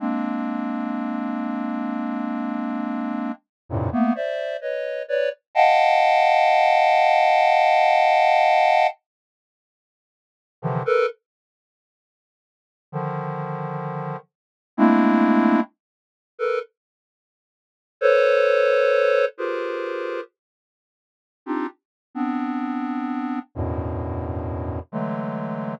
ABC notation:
X:1
M:6/4
L:1/16
Q:1/4=65
K:none
V:1 name="Lead 1 (square)"
[_A,_B,CD]16 [F,,G,,_A,,=A,,_B,,C,] [=A,B,=B,] [cde]2 [B_d_e]2 [Bd=d] z | [_ef_g=ga]16 z6 [C,D,_E,=E,F,] [A_B=B] | z8 [D,_E,F,]6 z2 [_A,=A,_B,CD=E]4 z3 [A_B=B] | z6 [ABc_d]6 [FG_A_B=Bc]4 z5 [C=D_EFG] z2 |
[B,CD]6 [E,,_G,,=G,,A,,B,,]6 [D,E,_G,_A,=A,]4 z8 |]